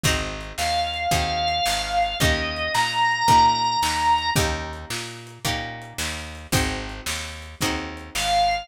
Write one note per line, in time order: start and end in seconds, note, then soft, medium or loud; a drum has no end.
0.04 0.53 G#1 medium
0.04 1.02 C4 medium
0.04 1.02 D#4 loud
0.04 1.02 F#4 loud
0.04 1.02 G#4 medium
0.04 kick loud
0.04 closed hi-hat loud
0.41 closed hi-hat medium
0.58 1.07 D#2 medium
0.58 2.18 F5 medium
0.58 snare loud
0.94 closed hi-hat medium
1.11 1.60 D#2 medium
1.11 2.09 C4 medium
1.11 2.09 D#4 medium
1.11 2.09 F#4 medium
1.11 2.09 G#4 medium
1.11 kick loud
1.11 closed hi-hat loud
1.48 closed hi-hat medium
1.66 2.15 G#1 medium
1.66 snare loud
2.03 closed hi-hat medium
2.20 2.69 D#2 medium
2.20 3.19 A#3 loud
2.20 3.19 C#4 medium
2.20 3.19 D#4 loud
2.20 3.19 G4 medium
2.20 2.73 D#5 medium
2.20 kick loud
2.20 closed hi-hat loud
2.56 closed hi-hat medium
2.74 3.23 A#2 medium
2.74 4.30 A#5 medium
2.74 snare loud
3.11 closed hi-hat medium
3.28 3.77 A#2 medium
3.28 4.25 A#3 medium
3.28 4.25 C#4 medium
3.28 4.25 D#4 medium
3.28 4.25 G4 medium
3.28 kick loud
3.28 closed hi-hat loud
3.64 closed hi-hat medium
3.83 4.31 D#2 medium
3.83 snare loud
4.18 closed hi-hat medium
4.36 4.85 D#2 medium
4.36 5.33 A#3 medium
4.36 5.33 C#4 medium
4.36 5.33 D#4 medium
4.36 5.33 G4 loud
4.36 kick loud
4.36 closed hi-hat loud
4.73 closed hi-hat medium
4.90 5.39 A#2 medium
4.90 snare loud
5.27 closed hi-hat medium
5.45 5.94 A#2 medium
5.45 6.42 A#3 medium
5.45 6.42 C#4 medium
5.45 6.42 D#4 medium
5.45 6.42 G4 medium
5.45 kick medium
5.45 closed hi-hat loud
5.82 closed hi-hat medium
5.98 6.47 D#2 medium
5.98 snare loud
6.35 closed hi-hat medium
6.52 7.01 G#1 medium
6.52 7.50 C4 loud
6.52 7.50 D#4 medium
6.52 7.50 F#4 medium
6.52 7.50 G#4 medium
6.52 kick loud
6.52 closed hi-hat loud
6.89 closed hi-hat medium
7.06 7.55 D#2 medium
7.06 snare loud
7.42 closed hi-hat medium
7.61 8.10 D#2 medium
7.61 8.60 C4 medium
7.61 8.60 D#4 medium
7.61 8.60 F#4 medium
7.61 8.60 G#4 medium
7.61 kick loud
7.61 closed hi-hat loud
7.97 closed hi-hat medium
8.15 8.64 G#1 medium
8.15 8.67 F5 medium
8.15 snare loud
8.51 closed hi-hat medium